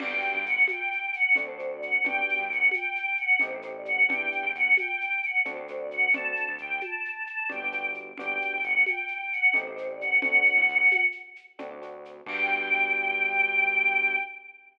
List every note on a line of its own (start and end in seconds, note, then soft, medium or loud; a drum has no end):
0.00 0.21 G1 medium
0.00 0.37 B3 loud
0.00 0.37 D4 loud
0.00 0.37 F#4 loud
0.00 0.37 G4 loud
0.00 0.45 G5 medium
0.00 crash loud
0.00 low conga loud
0.00 shaker medium
0.22 shaker medium
0.34 0.45 G2 medium
0.45 0.66 G1 medium
0.45 0.63 F#5 medium
0.45 shaker medium
0.68 1.07 G5 medium
0.68 high conga loud
0.68 shaker medium
0.92 shaker medium
1.13 1.34 F#5 medium
1.13 shaker medium
1.35 1.98 D2 medium
1.35 1.45 A3 loud
1.35 1.45 C4 loud
1.35 1.45 D4 loud
1.35 1.45 F#4 loud
1.35 1.70 C5 medium
1.35 low conga medium
1.35 shaker loud
1.48 1.57 A3 medium
1.48 1.57 C4 medium
1.48 1.57 D4 loud
1.48 1.57 F#4 medium
1.59 1.95 A3 medium
1.59 1.95 C4 medium
1.59 1.95 D4 medium
1.59 1.95 F#4 medium
1.59 shaker medium
1.70 1.81 D5 medium
1.81 2.03 F#5 medium
1.81 shaker medium
2.04 2.25 G1 medium
2.04 2.41 B3 loud
2.04 2.41 D4 loud
2.04 2.41 F#4 loud
2.04 2.41 G4 loud
2.04 2.46 G5 medium
2.04 low conga loud
2.04 shaker medium
2.29 shaker medium
2.39 2.49 G2 medium
2.49 2.70 D2 medium
2.49 2.69 F#5 medium
2.49 shaker medium
2.71 3.13 G5 medium
2.71 high conga medium
2.71 shaker loud
2.96 shaker medium
3.17 3.37 F#5 medium
3.17 shaker medium
3.39 4.03 A1 medium
3.39 3.50 A3 loud
3.39 3.50 C4 loud
3.39 3.50 D#4 loud
3.39 3.50 G4 loud
3.39 3.69 C5 medium
3.39 low conga loud
3.39 shaker loud
3.52 3.61 A3 loud
3.52 3.61 C4 medium
3.52 3.61 D#4 medium
3.52 3.61 G4 medium
3.62 4.00 A3 medium
3.62 4.00 C4 medium
3.62 4.00 D#4 medium
3.62 4.00 G4 medium
3.62 shaker medium
3.75 3.86 D5 medium
3.85 4.07 F#5 medium
3.85 shaker medium
4.09 4.29 E2 medium
4.09 4.46 B3 loud
4.09 4.46 D4 loud
4.09 4.46 E4 loud
4.09 4.46 G4 loud
4.09 4.51 G5 medium
4.09 low conga loud
4.09 shaker medium
4.32 shaker medium
4.43 4.53 E2 medium
4.54 4.75 E2 medium
4.54 4.74 F#5 medium
4.54 shaker medium
4.77 5.20 G5 medium
4.77 high conga medium
4.77 shaker medium
5.01 shaker medium
5.23 5.41 F#5 medium
5.23 shaker medium
5.45 6.08 D2 medium
5.45 5.55 A3 loud
5.45 5.55 C4 loud
5.45 5.55 D4 loud
5.45 5.55 F#4 loud
5.45 5.78 C5 medium
5.45 low conga loud
5.45 shaker medium
5.56 5.66 A3 medium
5.56 5.66 C4 loud
5.56 5.66 D4 medium
5.56 5.66 F#4 loud
5.68 6.06 A3 loud
5.68 6.06 C4 loud
5.68 6.06 D4 medium
5.68 6.06 F#4 medium
5.68 shaker medium
5.79 5.90 D5 medium
5.91 6.10 F#5 medium
5.91 shaker medium
6.14 6.34 D2 medium
6.14 6.50 A3 medium
6.14 6.50 C4 loud
6.14 6.50 D4 medium
6.14 6.50 F#4 loud
6.14 6.51 A5 medium
6.14 low conga loud
6.14 shaker medium
6.36 shaker medium
6.48 6.58 D2 medium
6.58 6.80 D2 medium
6.58 6.80 G5 medium
6.58 shaker medium
6.81 7.24 A5 medium
6.81 high conga medium
6.81 shaker medium
7.05 shaker medium
7.27 7.47 A5 medium
7.27 shaker medium
7.49 8.13 G1 medium
7.49 7.59 B3 medium
7.49 7.59 D4 loud
7.49 7.59 F#4 medium
7.49 7.59 G4 loud
7.49 7.87 G5 medium
7.49 low conga medium
7.49 shaker medium
7.63 7.72 B3 medium
7.63 7.72 D4 medium
7.63 7.72 F#4 medium
7.63 7.72 G4 loud
7.72 8.09 B3 medium
7.72 8.09 D4 medium
7.72 8.09 F#4 medium
7.72 8.09 G4 medium
7.72 shaker medium
7.94 shaker medium
8.18 8.39 G1 medium
8.18 8.55 B3 loud
8.18 8.55 D4 loud
8.18 8.55 F#4 medium
8.18 8.55 G4 loud
8.18 8.62 G5 medium
8.18 low conga loud
8.18 shaker loud
8.41 shaker medium
8.52 8.62 G1 medium
8.63 8.84 G1 medium
8.63 8.85 F#5 medium
8.63 shaker medium
8.86 9.29 G5 medium
8.86 high conga medium
8.86 shaker medium
9.08 shaker medium
9.32 9.53 F#5 medium
9.32 shaker medium
9.54 10.17 A1 medium
9.54 9.63 A3 loud
9.54 9.63 C4 loud
9.54 9.63 D#4 loud
9.54 9.63 G4 loud
9.54 9.87 C5 medium
9.54 low conga medium
9.54 shaker medium
9.67 9.76 A3 medium
9.67 9.76 C4 medium
9.67 9.76 D#4 loud
9.67 9.76 G4 medium
9.77 10.13 A3 medium
9.77 10.13 C4 medium
9.77 10.13 D#4 medium
9.77 10.13 G4 medium
9.77 shaker medium
9.89 10.00 D5 medium
10.00 10.21 F#5 medium
10.00 shaker medium
10.22 10.43 D2 medium
10.22 10.59 A3 loud
10.22 10.59 C4 loud
10.22 10.59 D4 loud
10.22 10.59 F#4 loud
10.22 11.01 F#5 medium
10.22 low conga loud
10.22 shaker medium
10.45 shaker medium
10.57 10.67 A2 medium
10.68 10.89 D2 medium
10.68 shaker medium
10.91 high conga loud
10.91 shaker loud
11.12 shaker medium
11.36 shaker medium
11.59 12.22 D2 medium
11.59 11.68 A3 loud
11.59 11.68 C4 loud
11.59 11.68 D4 loud
11.59 11.68 F#4 loud
11.59 low conga loud
11.59 shaker medium
11.71 11.80 A3 medium
11.71 11.80 C4 medium
11.71 11.80 D4 loud
11.71 11.80 F#4 medium
11.82 12.18 A3 medium
11.82 12.18 C4 medium
11.82 12.18 D4 medium
11.82 12.18 F#4 loud
11.82 shaker medium
12.05 shaker medium
12.26 14.16 G2 medium
12.26 14.16 B3 loud
12.26 14.16 D4 loud
12.26 14.16 F#4 medium
12.26 14.16 G4 loud
12.26 14.18 G5 loud
12.26 kick loud
12.26 crash loud